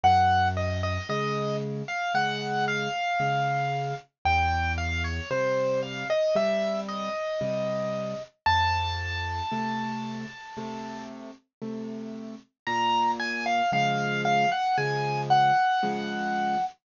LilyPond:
<<
  \new Staff \with { instrumentName = "Acoustic Grand Piano" } { \time 4/4 \key bes \minor \tempo 4 = 57 ges''8 ees''16 ees''16 ees''8 r16 f''16 ges''8 f''4. | g''8 f''16 des''16 c''8 f''16 dis''16 e''8 ees''4. | a''2. r4 | bes''8 aes''16 f''16 f''8 f''16 ges''16 aes''8 ges''4. | }
  \new Staff \with { instrumentName = "Acoustic Grand Piano" } { \time 4/4 \key bes \minor ges,4 <des aes>4 <des aes>4 <des aes>4 | e,4 <c g>4 <c g>4 <c g>4 | f,4 <c a>4 <c a>4 <c a>4 | bes,4 <des f aes>4 <des f aes>4 <des f aes>4 | }
>>